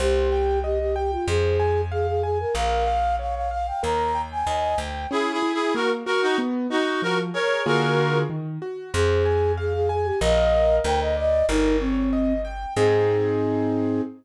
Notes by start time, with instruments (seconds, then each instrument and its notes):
0.00 electric bass (finger) C2, flute G4, acoustic grand piano C5
0.32 acoustic grand piano G5
0.64 flute G4, acoustic grand piano D#5
0.80 flute G4
0.96 flute G4, acoustic grand piano G5
1.12 flute F4
1.28 electric bass (finger) F2, flute G#4, acoustic grand piano C5
1.60 acoustic grand piano G#5
1.92 flute G#4, acoustic grand piano F5
2.07 flute G#4
2.23 flute G#4, acoustic grand piano G#5
2.40 flute A#4
2.54 electric bass (finger) A#1, acoustic grand piano A#4, flute F5
2.87 acoustic grand piano F5
3.19 acoustic grand piano C#5, flute F5
3.35 flute F5
3.51 acoustic grand piano F5, flute F5
3.67 flute G5
3.83 electric bass (finger) D#2, acoustic grand piano A#4, flute A#5
4.15 acoustic grand piano G5
4.32 flute G#5
4.47 electric bass (finger) D#2, acoustic grand piano D#5
4.78 electric bass (finger) D2, acoustic grand piano G5
5.11 acoustic grand piano C#4, clarinet E4 G#4
5.32 clarinet E4 G#4
5.43 acoustic grand piano E4
5.54 clarinet E4 G#4
5.75 acoustic grand piano A#3, clarinet F#4 A#4
6.06 clarinet F#4 A#4, acoustic grand piano F#4
6.22 clarinet D#4 F#4
6.38 acoustic grand piano B3
6.70 acoustic grand piano D#4, clarinet D#4 F#4
7.02 acoustic grand piano F3, clarinet F#4 A#4
7.34 acoustic grand piano G#4, clarinet A#4 C#5
7.66 acoustic grand piano D3 A#3 F4 G#4, clarinet F#4 A#4
8.30 acoustic grand piano D#3
8.62 acoustic grand piano F#4
8.93 electric bass (finger) F2, flute G#4, acoustic grand piano C5
9.25 acoustic grand piano G#5
9.57 flute G#4, acoustic grand piano F5
9.74 flute G#4
9.89 flute G#4, acoustic grand piano G#5
10.04 flute G4
10.21 electric bass (finger) A#1, acoustic grand piano A#4 D#5 F5, flute D#5
10.84 electric bass (finger) D2, acoustic grand piano A#4, flute G5
11.01 flute D#5
11.17 acoustic grand piano D5, flute D#5
11.49 electric bass (finger) G1, flute D#4, acoustic grand piano A#4
11.80 flute C4, acoustic grand piano C#5
12.13 acoustic grand piano D#5
12.45 acoustic grand piano G5
12.76 electric bass (finger) G#2, acoustic grand piano C4 D#4 G#4, flute G#4